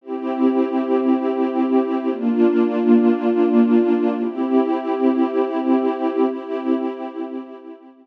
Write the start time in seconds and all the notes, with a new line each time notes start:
0.01 C4 E4 G4
2.09 A#3 D4 F4
4.19 C4 E4 G4
6.27 C4 E4 G4